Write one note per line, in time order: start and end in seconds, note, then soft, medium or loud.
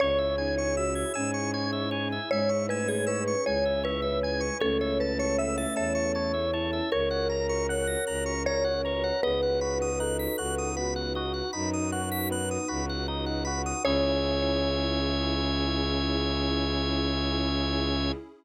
0.00 1.04 C#2 medium
0.00 4.57 C#4 medium
0.00 0.36 C#4 medium
0.00 4.57 E4 medium
0.00 4.57 G#4 medium
0.00 2.15 C#5 loud
0.00 0.35 C#5 loud
0.00 0.19 C#5 loud
0.18 0.36 E5 medium
0.38 0.74 D#4 medium
0.38 0.55 G#5 medium
0.38 0.73 G#5 medium
0.58 0.75 C#6 loud
0.77 1.12 F#4 medium
0.77 1.12 E5 medium
0.77 0.94 E6 medium
0.95 1.13 G#6 medium
1.14 2.19 G#2 medium
1.14 2.13 C#4 medium
1.14 1.50 G#5 medium
1.14 1.31 E6 loud
1.34 1.51 C#6 medium
1.54 1.88 C#5 medium
1.54 1.71 G#5 loud
1.73 1.90 E5 medium
1.91 2.08 C#5 medium
1.91 2.27 G#5 medium
2.12 2.30 E5 medium
2.31 3.35 G#2 medium
2.31 2.66 G#3 medium
2.31 2.62 C#5 medium
2.31 2.66 E5 medium
2.31 2.50 G#5 loud
2.49 2.66 C#6 medium
2.69 3.32 A3 medium
2.69 2.87 B4 medium
2.69 3.04 G#5 medium
2.69 2.88 E6 medium
2.88 3.07 G#4 medium
2.88 3.05 G#6 medium
3.07 3.42 B4 medium
3.07 3.43 C#5 medium
3.07 3.24 E6 loud
3.28 3.45 C#6 medium
3.46 4.50 C#2 medium
3.46 4.54 G#3 medium
3.46 3.80 C#5 medium
3.46 3.81 G#5 medium
3.46 3.64 G#5 loud
3.65 3.83 E5 medium
3.83 4.49 B4 loud
3.83 4.01 C#5 loud
3.83 4.20 E5 medium
4.02 4.20 E5 medium
4.23 4.58 G#5 medium
4.23 4.41 G#5 medium
4.41 4.58 C#6 medium
4.60 5.66 C#2 medium
4.60 6.33 A3 medium
4.60 6.33 C#4 medium
4.60 6.90 C#4 medium
4.60 6.90 E4 medium
4.60 4.80 A4 loud
4.60 6.90 A4 medium
4.60 4.78 C#5 loud
4.60 4.96 C#5 medium
4.81 4.99 C#5 medium
4.81 4.98 E5 medium
5.00 5.18 B4 medium
5.00 5.35 A5 medium
5.00 5.18 A5 medium
5.19 5.38 C#5 medium
5.19 5.37 C#6 loud
5.38 5.57 E5 medium
5.38 5.73 E5 medium
5.38 5.56 E6 loud
5.58 5.76 E5 medium
5.58 5.75 A6 loud
5.76 6.81 E2 medium
5.76 6.83 C#5 medium
5.76 6.11 A5 medium
5.76 5.93 E6 medium
5.95 6.12 C#6 medium
6.15 6.50 C#5 medium
6.15 6.32 A5 medium
6.34 6.51 E5 medium
6.53 6.88 E4 medium
6.53 6.71 C#5 loud
6.53 6.88 A5 medium
6.73 6.90 E5 medium
6.92 7.96 C#2 medium
6.92 9.21 C#4 medium
6.92 9.21 F#4 medium
6.92 8.35 A#4 medium
6.92 9.21 A#4 medium
6.92 7.09 C#5 loud
6.92 7.27 C#5 loud
6.92 7.63 C#5 medium
7.11 7.28 F#5 loud
7.29 7.47 A#5 medium
7.29 7.66 A#5 medium
7.49 7.67 C#6 medium
7.69 8.32 C#5 medium
7.69 8.04 F#5 medium
7.69 7.87 F#6 medium
7.87 8.05 A#6 loud
8.07 9.12 C#2 medium
8.07 8.42 A#5 medium
8.07 8.24 F#6 medium
8.26 8.43 C#6 medium
8.46 8.82 A#4 medium
8.46 8.80 C#5 medium
8.46 9.18 C#5 medium
8.46 8.64 A#5 loud
8.64 8.82 F#5 loud
8.84 9.16 B4 medium
8.84 9.03 C#5 medium
8.84 9.19 A#5 medium
9.04 9.21 F#5 medium
9.23 10.27 C#2 medium
9.23 9.58 B3 medium
9.23 13.80 D#4 medium
9.23 13.80 F#4 medium
9.23 9.90 G#4 medium
9.23 11.81 B4 loud
9.23 13.80 B4 medium
9.23 9.90 B4 medium
9.23 9.41 D#5 loud
9.43 9.60 F#5 medium
9.61 9.96 F#4 medium
9.61 9.78 B5 loud
9.82 9.99 D#6 loud
9.99 10.34 D#4 medium
9.99 10.71 A4 medium
9.99 10.17 F#6 medium
10.19 10.37 B6 medium
10.38 11.42 C#2 medium
10.38 10.73 F#4 medium
10.38 10.55 F#6 medium
10.58 10.75 D#6 medium
10.77 11.11 B3 medium
10.77 11.49 F#4 medium
10.77 10.94 B5 medium
10.96 11.13 F#5 medium
11.15 11.51 F#4 medium
11.15 11.33 D#5 medium
11.34 11.51 F#5 medium
11.53 12.58 F#2 medium
11.53 11.88 D#4 medium
11.53 12.85 D#4 medium
11.53 11.70 B5 loud
11.73 11.91 D#6 medium
11.92 12.27 F#4 medium
11.92 12.09 F#6 medium
12.12 12.29 B6 loud
12.31 12.66 B3 medium
12.31 12.49 F#6 medium
12.51 12.68 D#6 medium
12.68 13.74 C#2 medium
12.68 13.04 F#4 medium
12.68 12.85 B5 medium
12.89 13.07 F#5 medium
13.08 13.43 D#4 medium
13.08 13.25 D#5 medium
13.26 13.44 F#5 medium
13.45 13.81 F#4 medium
13.45 13.62 B5 loud
13.66 13.83 D#6 loud
13.84 18.11 C#2 loud
13.84 18.11 C#4 loud
13.84 18.11 C#4 medium
13.84 18.11 E4 loud
13.84 18.12 E4 medium
13.84 18.11 G#4 loud
13.84 18.12 G#4 loud
13.84 18.11 C#5 loud
13.84 18.12 C#5 loud
13.84 18.12 E5 loud
13.84 18.12 G#5 loud
13.89 18.12 C#4 loud